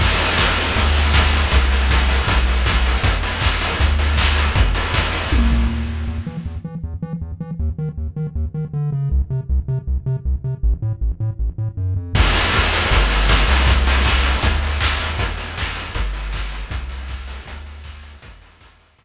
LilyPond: <<
  \new Staff \with { instrumentName = "Synth Bass 1" } { \clef bass \time 4/4 \key e \minor \tempo 4 = 158 e,2 d,2 | c,2 b,,2 | e,2 d,2 | e,2 b,,4 d,8 dis,8 |
e,8 e8 e,8 e8 e,8 e8 e,8 e8 | dis,8 dis8 dis,8 dis8 dis,8 dis8 d8 cis8 | c,8 c8 c,8 c8 c,8 c8 c,8 c8 | a,,8 a,8 a,,8 a,8 a,,8 a,8 fis,8 f,8 |
e,2 g,,4. c,8~ | c,2 d,4 d,8 dis,8 | e,2 g,,2 | c,2 d,2 |
e,2 e,2 | }
  \new DrumStaff \with { instrumentName = "Drums" } \drummode { \time 4/4 <cymc bd>8 hho8 <bd sn>8 hho8 <hh bd>8 hho8 <bd sn>8 hho8 | <hh bd>8 hho8 <bd sn>8 hho8 <hh bd>8 hho8 <bd sn>8 hho8 | <hh bd>8 hho8 <hc bd>8 hho8 <hh bd>8 hho8 <hc bd>8 hho8 | <hh bd>8 hho8 <bd sn>8 hho8 <bd tommh>8 tomfh8 r4 |
r4 r4 r4 r4 | r4 r4 r4 r4 | r4 r4 r4 r4 | r4 r4 r4 r4 |
<cymc bd>8 hho8 <bd sn>8 hho8 <hh bd>8 hho8 <bd sn>8 hho8 | <hh bd>8 hho8 <hc bd>8 hho8 <hh bd>8 hho8 <hc bd>8 hho8 | <hh bd>8 hho8 <hc bd>8 hho8 <hh bd>8 hho8 <hc bd>8 hho8 | <hh bd>8 hho8 <hc bd>8 hho8 <hh bd>8 hho8 <hc bd>8 hho8 |
<hh bd>8 hho8 <bd sn>8 hho8 <hh bd>4 r4 | }
>>